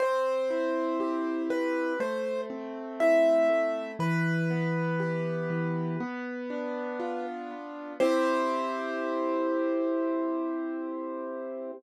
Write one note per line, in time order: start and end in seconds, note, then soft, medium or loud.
0.00 1.49 C4 loud
0.00 1.42 C5 medium
0.50 1.93 E4 medium
1.00 1.95 G4 medium
1.50 1.97 C4 medium
1.50 1.99 B4 medium
2.00 3.49 A3 loud
2.00 2.41 C5 medium
2.50 3.92 C4 medium
3.00 3.95 E4 medium
3.00 3.91 E5 medium
3.50 3.97 A3 medium
3.99 5.50 E3 loud
3.99 7.24 B4 medium
4.50 5.93 B3 medium
5.00 5.95 G4 medium
5.50 5.97 E3 medium
6.00 7.50 B3 loud
6.50 7.93 D4 medium
7.00 7.95 F4 medium
7.51 7.98 B3 medium
8.00 11.72 C4 loud
8.00 11.72 E4 loud
8.00 11.72 G4 loud
8.00 11.71 C5 loud